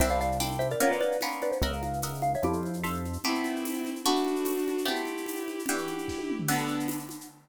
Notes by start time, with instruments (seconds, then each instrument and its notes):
0.00 synth bass 1 C2, acoustic guitar (steel) C4 D4 E4 G4, xylophone C5 E5, crash, low conga, shaker
0.08 xylophone D5 F5, shaker
0.20 xylophone D5 F5, shaker
0.32 shaker
0.40 acoustic guitar (steel) C4 D4 E4 G4, tambourine, high conga, shaker
0.52 shaker
0.59 xylophone C5 E5, high conga, shaker
0.70 xylophone A#4 D5, shaker
0.80 acoustic guitar (steel) A#3 B3 C#4 F4, xylophone A#4 C#5, low conga, shaker
0.91 xylophone B4 D5, shaker
1.01 xylophone B4 D5, high conga, shaker
1.12 shaker
1.20 acoustic guitar (steel) A#3 B3 C#4 F4, tambourine, high conga, shaker
1.31 shaker
1.41 xylophone B4 D5, high conga, shaker
1.52 xylophone C5, shaker
1.62 synth bass 1 C#2, acoustic guitar (steel) A#4 D#5 E5 F#5, xylophone C#5 E5, low conga, shaker
1.73 xylophone F5, shaker
1.83 xylophone F5, high conga, shaker
1.93 shaker
2.02 acoustic guitar (steel) A#4 D#5 E5 F#5, tambourine, high conga, shaker
2.14 shaker
2.22 xylophone F5, high conga, shaker
2.34 xylophone C#5 E5, shaker
2.42 synth bass 1 F2, xylophone E4 G4, acoustic guitar (steel) A4 C5 E5 F5, low conga, shaker
2.53 shaker
2.63 high conga, shaker
2.73 shaker
2.83 acoustic guitar (steel) A4 C5 E5 F5, tambourine, high conga, shaker
2.94 shaker
3.05 high conga, shaker
3.13 shaker
3.24 acoustic guitar (steel) A3 B3 C4 G4, violin C4 E4, low conga, shaker
3.35 shaker
3.44 high conga, shaker
3.56 shaker
3.65 tambourine, high conga, shaker
3.74 shaker
3.85 high conga, shaker
3.96 shaker
4.04 acoustic guitar (steel) A3 B3 D4 F#4, violin D4 F#4, low conga, shaker
4.16 shaker
4.25 high conga, shaker
4.36 shaker
4.44 tambourine, high conga, shaker
4.58 shaker
4.68 high conga, shaker
4.78 shaker
4.85 acoustic guitar (steel) A3 B3 C4 G4, violin E4 G4, low conga, shaker
4.96 shaker
5.05 high conga, shaker
5.17 shaker
5.26 tambourine, high conga, shaker
5.36 shaker
5.48 high conga, shaker
5.59 shaker
5.66 acoustic guitar (steel) E3 D4 F#4 G4, violin E4 G4, low conga, shaker
5.78 shaker
5.87 high conga, shaker
5.98 shaker
6.08 kick, snare
6.18 high tom
6.30 mid tom
6.39 floor tom
6.48 acoustic guitar (steel) D3 B3 F#4 A4, violin B3 D4, crash, low conga, shaker
6.58 shaker
6.68 shaker
6.80 shaker
6.88 tambourine, high conga, shaker
6.99 shaker
7.09 high conga, shaker
7.21 shaker